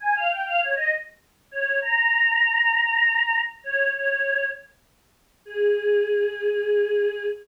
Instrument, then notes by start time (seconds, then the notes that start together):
choir aahs
0.00 G#5
0.15 F5
0.30 G5
0.46 F5
0.61 C#5
0.76 D#5
1.51 C#5
1.82 A#5
3.64 C#5
3.94 C#5
5.45 G#4